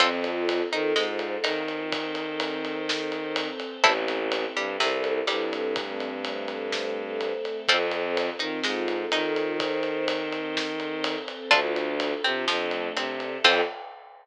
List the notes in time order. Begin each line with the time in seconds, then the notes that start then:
0.00 F2 C4 F4 A4, kick, ride
0.24 ride
0.49 ride
0.72 D#3 D#4, ride
0.96 G#2 G#3, snare
1.19 ride
1.44 D#3 D#4, ride
1.68 ride
1.92 C4 A4 C5, kick, ride
2.15 ride
2.40 ride
2.65 ride
2.89 snare
3.12 ride
3.36 ride
3.60 ride
3.84 A1 C4 E4 A4, kick, ride
4.08 ride
4.32 ride
4.56 G2 G3, ride
4.80 C2 C3, snare
5.04 ride
5.27 G2 G3, ride
5.53 ride
5.76 A3 C4 A4, kick, ride
6.00 ride
6.25 ride
6.48 ride
6.72 snare
7.21 ride
7.45 ride
7.68 F2 C4 F4 A4, kick, ride
7.91 ride
8.17 ride
8.39 D#3 D#4, ride
8.63 G#2 G#3, snare
8.88 ride
9.12 D#3 D#4, ride
9.36 ride
9.60 C4 A4 C5, kick, ride
9.83 ride
10.08 ride
10.32 ride
10.57 snare
10.80 ride
11.04 ride
11.28 ride
11.51 D2 D4 F4 A4, kick, ride
11.76 ride
12.00 ride
12.24 C3 C4, ride
12.48 F2 F3 A3 D4 A4, snare
12.71 ride
12.96 C3 C4, ride
13.20 ride
13.44 F2 C4 F4 A4, kick, crash